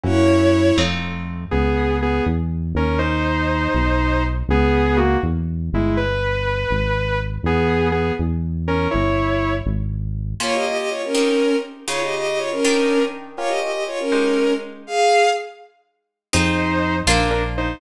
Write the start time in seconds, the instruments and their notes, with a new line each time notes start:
0.03 synth bass 1 F#2, orchestral harp A#3 C#4 E4 F#4, violin E4 C#5
0.77 synth bass 1 F2, orchestral harp A3 C4 D#4 F4
1.51 synth bass 1 C#2, lead 2 (sawtooth) B3 G#4
2.02 lead 2 (sawtooth) B3 G#4
2.26 synth bass 1 E2
2.75 synth bass 1 D#2, lead 2 (sawtooth) C#4 A#4
2.99 lead 2 (sawtooth) D#4 C5
3.75 synth bass 1 B1
4.49 synth bass 1 C#2, lead 2 (sawtooth) B3 G#4
4.97 lead 2 (sawtooth) A#3 F#4
5.23 synth bass 1 E2
5.73 synth bass 1 G1, lead 2 (sawtooth) G#3 E4
5.97 lead 2 (sawtooth) B4
6.70 synth bass 1 G#1
7.43 synth bass 1 E2, lead 2 (sawtooth) B3 G#4
7.92 lead 2 (sawtooth) B3 G#4
8.19 synth bass 1 E2
8.68 lead 2 (sawtooth) C#4 A#4
8.91 synth bass 1 G1, lead 2 (sawtooth) E4 C#5
9.66 synth bass 1 G#1
10.40 orchestral harp A#3 C#4 F4 G4, violin F4 C#5
10.54 violin G4 D#5
10.66 violin G4 D#5
10.78 violin G4 D#5
10.90 violin F4 C#5
11.05 violin C#4 A#4
11.15 orchestral harp C4 D#4 G4 G#4
11.88 orchestral harp C#3 D#4 F4 G#4, violin F4 C#5
12.03 violin G4 D#5
12.15 violin G4 D#5
12.27 violin G4 D#5
12.38 violin F4 C#5
12.52 violin C#4 A#4
12.65 orchestral harp D#3 D4 G4 A#4
13.37 orchestral harp C#4 F4 G4 A#4, violin F4 C#5
13.48 violin G4 D#5
13.60 violin G4 D#5
13.72 violin G4 D#5
13.87 violin F4 C#5
14.00 violin C#4 A#4
14.12 orchestral harp G#3 D#4 G4 C5
14.87 violin G#4 F5
16.33 synth bass 1 F2, orchestral harp C4 D#4 F4 G#4, lead 2 (sawtooth) D#4 C5
17.07 synth bass 1 A#1, orchestral harp A#3 C4 D4 F4, lead 2 (sawtooth) D4 A#4
17.31 lead 2 (sawtooth) D4 A#4
17.58 lead 2 (sawtooth) D#4 C5